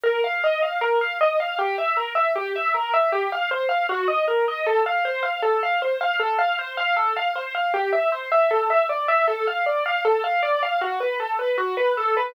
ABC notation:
X:1
M:4/4
L:1/16
Q:1/4=78
K:F
V:1 name="Acoustic Grand Piano"
B f _e f B f e f G =e B e G e B e | G f c f _G _e B e A f c f A f c f | A f c f A f c f G e c e A e d e | A f d f A f d f ^F =B A B F B A B |]